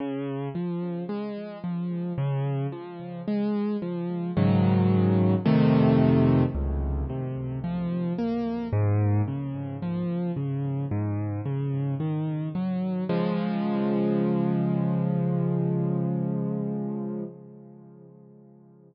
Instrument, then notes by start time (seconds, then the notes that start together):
acoustic grand piano
0.00 C#3
0.55 F3
1.09 G#3
1.64 F3
2.18 C#3
2.72 F3
3.27 G#3
3.82 F3
4.37 G#2 C#3 D#3 F#3
5.45 F2 C3 D#3 A3
6.55 C#2
7.09 C3
7.64 F3
8.18 A#3
8.72 G#2
9.27 C#3
9.82 F3
10.36 C#3
10.91 G#2
11.45 C#3
12.00 D#3
12.55 F#3
13.09 C#3 F3 G#3